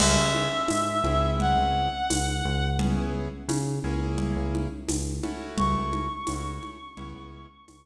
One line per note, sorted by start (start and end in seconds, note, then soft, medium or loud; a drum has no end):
0.00 0.16 C#2 loud
0.00 0.49 C#4 loud
0.00 0.49 E4 medium
0.00 0.49 G#4 loud
0.00 1.31 E5 medium
0.00 crash loud
0.00 low conga loud
0.17 0.48 C#3 medium
0.35 high conga medium
0.68 1.02 G#2 medium
0.68 tambourine medium
0.68 high conga loud
1.04 1.54 C#2 loud
1.04 1.88 C4 loud
1.04 1.88 C#4 loud
1.04 1.88 E4 loud
1.04 1.88 G#4 medium
1.04 high conga medium
1.40 2.68 F#5 medium
1.40 low conga medium
1.57 1.88 C#2 medium
2.10 2.42 C#2 medium
2.10 tambourine loud
2.10 high conga loud
2.45 2.95 C#2 loud
2.79 3.28 B3 loud
2.79 3.28 C#4 loud
2.79 3.28 E4 loud
2.79 3.28 G#4 loud
2.79 low conga loud
2.97 3.28 C#2 medium
3.48 3.80 C#3 medium
3.48 tambourine medium
3.48 high conga loud
3.84 4.34 C#2 medium
3.84 4.68 A#3 loud
3.84 4.68 C#4 loud
3.84 4.68 E4 loud
3.84 4.68 G#4 loud
4.18 low conga loud
4.36 4.67 C#2 medium
4.55 high conga medium
4.89 5.21 C#2 medium
4.89 tambourine medium
4.89 high conga loud
5.23 6.07 A3 loud
5.23 6.07 C#4 medium
5.23 6.07 E4 loud
5.23 6.07 F#4 loud
5.23 high conga medium
5.58 5.75 C#2 medium
5.58 7.86 C#6 soft
5.58 low conga loud
5.77 6.08 C#2 medium
5.93 high conga medium
6.27 6.59 C#2 medium
6.27 6.77 A3 medium
6.27 6.77 C#4 medium
6.27 6.77 E4 medium
6.27 6.77 F#4 medium
6.27 tambourine medium
6.27 high conga loud
6.63 high conga medium
6.97 7.14 C#2 medium
6.97 7.47 G#3 loud
6.97 7.47 B3 loud
6.97 7.47 C#4 loud
6.97 7.47 E4 loud
6.97 low conga medium
7.15 7.46 C#2 medium
7.68 7.86 C#2 medium
7.68 tambourine medium
7.68 high conga loud